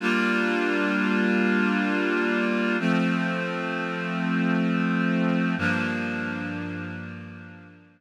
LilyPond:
\new Staff { \time 4/4 \key g \dorian \tempo 4 = 86 <g bes d' f'>1 | <f a c'>1 | <g, f bes d'>1 | }